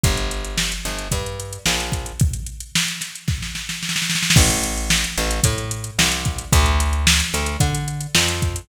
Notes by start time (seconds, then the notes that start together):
0.03 G1, kick, closed hi-hat
0.17 closed hi-hat
0.31 closed hi-hat
0.45 closed hi-hat
0.58 snare
0.72 closed hi-hat
0.85 G1, snare, closed hi-hat
0.99 closed hi-hat
1.11 G2, kick, closed hi-hat
1.26 closed hi-hat
1.40 closed hi-hat
1.53 closed hi-hat
1.66 A#1, snare
1.80 closed hi-hat
1.92 kick, closed hi-hat
2.06 closed hi-hat
2.20 kick, closed hi-hat
2.33 closed hi-hat
2.47 closed hi-hat
2.60 closed hi-hat
2.75 snare
2.88 closed hi-hat
3.01 snare, closed hi-hat
3.15 closed hi-hat
3.28 kick, snare
3.42 snare
3.55 snare
3.69 snare
3.83 snare
3.89 snare
3.96 snare
4.02 snare
4.10 snare
4.15 snare
4.23 snare
4.30 snare
4.36 A1, kick, crash
4.50 closed hi-hat
4.64 closed hi-hat
4.77 closed hi-hat
4.90 snare
5.04 closed hi-hat
5.18 A1, snare, closed hi-hat
5.31 closed hi-hat
5.43 A2, kick, closed hi-hat
5.58 closed hi-hat
5.71 closed hi-hat
5.84 closed hi-hat
5.99 C2, snare
6.12 closed hi-hat
6.25 kick, closed hi-hat
6.38 closed hi-hat
6.52 D2, kick, closed hi-hat
6.66 closed hi-hat
6.80 closed hi-hat
6.93 closed hi-hat
7.07 snare
7.20 closed hi-hat
7.33 D2, snare, closed hi-hat
7.46 closed hi-hat
7.60 D3, kick, closed hi-hat
7.75 closed hi-hat
7.88 closed hi-hat
8.01 closed hi-hat
8.15 F2, snare
8.28 closed hi-hat
8.42 kick, closed hi-hat
8.56 closed hi-hat